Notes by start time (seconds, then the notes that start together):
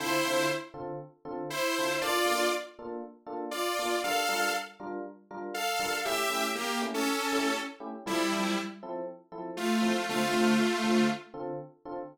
0.00 D3 C4 E4 F4 A4 C5
0.25 D3 C4 F4 A4
0.74 D3 C4 F4 A4
1.25 D3 C4 F4 A4
1.50 E4 C5
1.78 D3 C4 F4 A4
2.01 A#3 D4 F4 A4 D5
2.25 A#3 D4 F4 A4
2.79 A#3 D4 F4 A4
3.26 A#3 D4 F4 A4
3.51 F4 D5
3.79 A#3 D4 F4 A4
4.04 G3 D4 F4 A4 A#4 F5
4.29 G3 D4 F4 A#4
4.80 G3 D4 F4 A#4
5.31 G3 D4 F4 A#4
5.54 A4 F5
5.80 G3 D4 F4 A#4
6.05 A3 C#4 E4 G4 E5
6.30 A3 C#4 E4 G4
6.55 A#3 G4
6.82 A3 C#4 E4 G4
6.94 C#4 A4
7.32 A3 C#4 E4 G4
7.80 A3 C#4 E4 G4
8.06 F3 G3 C4 E4 A4
8.32 F3 C4 E4 A4
8.83 F3 C4 E4 A4
9.32 F3 C4 E4 A4
9.57 A3 F4
9.82 F3 C4 E4 A4
10.09 D3 A3 C4 F4 A4
10.33 D3 C4 F4 A4
10.84 D3 C4 F4 A4
11.34 D3 C4 F4 A4
11.86 D3 C4 F4 A4